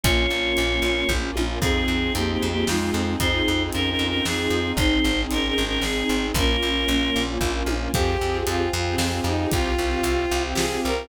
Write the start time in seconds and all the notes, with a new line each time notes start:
0.04 A#1 A#3 C#4 F4 C#5, kick, closed hi-hat
0.30 A#1
0.45 A#3 C#4 F4
0.57 A#1, closed hi-hat
0.70 A#3 C#4 F4
0.82 A#1
0.96 A#3 C#4 F4
1.09 A#1 A#3 C#4 F4, kick, high tom
1.23 A#3 C#4 F4
1.36 A#1, high tom
1.49 A#3 C#4 F4
1.61 F2 C4 D#4 F4 G#4, kick, crash
1.88 F2
2.02 C4 D#4 F4 G#4
2.15 F2 A#3 G4, closed hi-hat
2.29 A#3 C4 D#4 F4 G4 G#4
2.42 F2
2.51 A#3 C4 D#4 F4 G4 G#4
2.67 F2 G#3 C4 D#4 F4 G#4, snare
2.81 C4 D#4 F4 G#4
2.94 F2
3.07 C4 D#4 F4 G#4
3.20 F2 C4 D#4 F4 G#4 C5, kick, closed hi-hat
3.48 F2
3.59 C4 D#4 F4 G#4
3.72 F2 C#4 A#4, closed hi-hat
3.86 C4 D#4 F4 G#4
3.90 C#4 A#4
3.99 F2
4.08 C#4 A#4
4.13 C4 D#4 F4 G#4
4.25 F2 C4 D#4 F4 G#4, snare
4.38 C4 D#4 F4 G#4
4.50 F2
4.66 C4 D#4 F4 G#4
4.77 G#1 C4 D#4 G#4 C5, kick, closed hi-hat
5.04 G#1
5.18 C4 D#4 G#4
5.31 G#1 C#4 A#4, closed hi-hat
5.43 C4 D#4 G#4
5.48 C#4 A#4
5.58 G#1
5.67 C4 C#4 D#4 G#4 A#4
5.81 G#1 C4 D#4 G#4, snare
5.95 C4 D#4 G#4
6.09 G#1
6.23 C4 D#4 G#4
6.34 A#1 A#3 C#4 F4 A#4, kick, closed hi-hat
6.63 A#1
6.75 A#3 C#4 F4
6.88 A#1, closed hi-hat
7.01 A#3 C#4 F4
7.16 A#1
7.28 A#3 C#4 F4
7.41 A#1 A#3 C#4 F4, kick, high tom
7.55 A#3 C#4 F4
7.66 A#1, high tom
7.81 A#3 C#4 F4
7.93 F2 C4 F4 G4 G#4 C5 F5 G5 G#5, kick, closed hi-hat
8.21 F2 C4 F4 G4 G#4
8.47 F2 F4, closed hi-hat
8.73 F2 F4
8.87 C4 F4 G4 G#4
8.98 F2, snare
9.11 C4 F4 G4 G#4
9.24 F2 D#4
9.39 C4 F4 G4 G#4
9.52 C2 C4 F4 G4 C5 F5 G5, kick, closed hi-hat
9.78 C2 C4 F4 G4
10.03 C2, closed hi-hat
10.31 C2
10.44 C4 F4 G4
10.55 C2 G#4, snare
10.71 C4 F4 G4
10.84 C2 A#4
10.97 C4 F4 G4